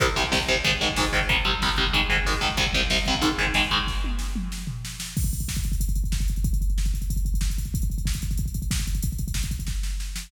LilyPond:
<<
  \new Staff \with { instrumentName = "Overdriven Guitar" } { \clef bass \time 4/4 \key c \minor \tempo 4 = 186 <c, c g>8 <c, c g>8 <c, c g>8 <c, c g>8 <aes, ees aes>8 <aes, ees aes>8 <aes, ees aes>8 <aes, ees aes>8 | <c, c g>8 <c, c g>8 <c, c g>8 <c, c g>8 <aes, ees aes>8 <aes, ees aes>8 <aes, ees aes>8 <aes, ees aes>8 | <c, c g>8 <c, c g>8 <c, c g>8 <c, c g>8 <aes, ees aes>8 <aes, ees aes>8 <aes, ees aes>8 <aes, ees aes>8 | r1 |
r1 | r1 | r1 | r1 | }
  \new DrumStaff \with { instrumentName = "Drums" } \drummode { \time 4/4 <hh bd>16 bd16 <hh bd>16 bd16 <bd sn>16 bd16 <hh bd>16 bd16 <hh bd>16 bd16 <hh bd>16 bd16 <bd sn>16 bd16 <hh bd>16 bd16 | <hh bd>16 bd16 <hh bd>16 bd16 <bd sn>16 bd16 <hh bd>16 bd16 <hh bd>16 bd16 <hh bd>16 bd16 <bd sn>16 bd16 <hh bd>16 bd16 | <hh bd>16 bd16 <hh bd>16 bd16 <bd sn>16 bd16 <hh bd>16 bd16 <hh bd>16 bd16 <hh bd>16 bd16 <bd sn>16 bd16 <hh bd>16 bd16 | <bd sn>8 tommh8 sn8 toml8 sn8 tomfh8 sn8 sn8 |
<cymc bd>16 <hh bd>16 <hh bd>16 <hh bd>16 <bd sn>16 <hh bd>16 <hh bd>16 <hh bd>16 <hh bd>16 <hh bd>16 <hh bd>16 <hh bd>16 <bd sn>16 <hh bd>16 <hh bd>16 <hh bd>16 | <hh bd>16 <hh bd>16 <hh bd>16 <hh bd>16 <bd sn>16 <hh bd>16 <hh bd>16 <hh bd>16 <hh bd>16 <hh bd>16 <hh bd>16 <hh bd>16 <bd sn>16 <hh bd>16 <hh bd>16 <hh bd>16 | <hh bd>16 <hh bd>16 <hh bd>16 <hh bd>16 <bd sn>16 <hh bd>16 <hh bd>16 <hh bd>16 <hh bd>16 <hh bd>16 <hh bd>16 <hh bd>16 <bd sn>16 <hh bd>16 <hh bd>16 <hh bd>16 | <hh bd>16 <hh bd>16 <hh bd>16 <hh bd>16 <bd sn>16 <hh bd>16 <hh bd>16 <hh bd>16 <bd sn>8 sn8 sn8 sn8 | }
>>